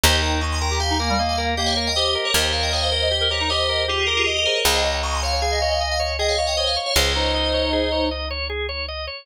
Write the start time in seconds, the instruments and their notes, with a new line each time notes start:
0.04 electric bass (finger) D#2, clarinet D#4, drawbar organ G4, tubular bells C5 D#5
0.13 tubular bells D#5 G5
0.23 drawbar organ A#4, tubular bells D#5 G5
0.41 drawbar organ D#5, tubular bells A#5 C#6
0.52 tubular bells G#5 C6
0.61 drawbar organ A#4, tubular bells G5 A#5
0.71 clarinet G4
0.80 drawbar organ G4, tubular bells F5 G#5
0.90 clarinet D#4
1.00 clarinet A#3, drawbar organ A#4
1.09 clarinet G3
1.19 clarinet A#3, drawbar organ D#5
1.29 tubular bells F5 G#5
1.38 drawbar organ A#4
1.57 clarinet A#3, drawbar organ G4, tubular bells D#5 G5
1.66 tubular bells C#5 F5
1.76 drawbar organ A#4, tubular bells C#5 F5
1.87 tubular bells D#5 G5
1.96 clarinet G4, tubular bells C5 D#5, drawbar organ D#5
2.06 tubular bells C5 D#5
2.15 drawbar organ A#4
2.25 tubular bells A#4 C#5
2.34 electric bass (finger) D#2, drawbar organ G4, clarinet A#4, tubular bells C5 D#5
2.53 drawbar organ A#4, tubular bells C#5 F5
2.63 tubular bells D#5 G5
2.72 tubular bells C#5 F5, drawbar organ D#5
2.82 tubular bells C5 D#5
2.92 drawbar organ A#4, tubular bells C5 D#5
3.02 clarinet D#5
3.11 drawbar organ G4, tubular bells C5 D#5
3.21 clarinet A#4
3.30 clarinet G4, drawbar organ A#4, tubular bells A#4 C#5
3.40 clarinet D#4
3.50 clarinet G4, tubular bells C5 D#5, drawbar organ D#5
3.69 drawbar organ A#4
3.88 tubular bells F4 G#4, drawbar organ G4, clarinet G4
4.07 tubular bells G4 A#4, drawbar organ A#4
4.17 tubular bells F4 G#4
4.26 tubular bells G4 A#4, drawbar organ D#5, clarinet D#5
4.37 tubular bells G4 A#4
4.46 tubular bells G#4 C5, drawbar organ A#4
4.56 tubular bells A#4 C#5
4.65 electric bass (finger) C#2, drawbar organ G#4, tubular bells C5 D#5, clarinet D#5
4.75 tubular bells D#5 G5
4.84 drawbar organ C#5, tubular bells D#5 G5
5.03 drawbar organ D#5, tubular bells A#5 C#6
5.15 tubular bells G#5 C6
5.23 drawbar organ C#5, tubular bells F5 G#5
5.32 clarinet C#5
5.42 drawbar organ G#4, tubular bells F5 G#5
5.51 clarinet D#5
5.61 drawbar organ C#5, clarinet D#5
5.71 clarinet D#5
5.80 drawbar organ D#5, clarinet D#5
5.91 tubular bells F5 G#5
6.00 drawbar organ C#5
6.19 drawbar organ G#4, clarinet D#5, tubular bells D#5 G5
6.29 tubular bells C#5 F5
6.38 tubular bells C#5 F5, drawbar organ C#5
6.47 tubular bells D#5 G5
6.57 tubular bells C5 D#5, clarinet C#5, drawbar organ D#5
6.67 tubular bells C#5 F5
6.76 drawbar organ C#5
6.86 tubular bells C#5 F5
6.95 electric bass (finger) C#2, drawbar organ G#4, tubular bells C5 D#5, clarinet C#5
7.15 clarinet D#4, drawbar organ C#5
7.34 drawbar organ D#5
7.54 drawbar organ C#5
7.73 drawbar organ G#4
7.92 drawbar organ C#5
8.11 drawbar organ D#5
8.31 drawbar organ C#5
8.50 drawbar organ G#4
8.69 drawbar organ C#5
8.88 drawbar organ D#5
9.07 drawbar organ C#5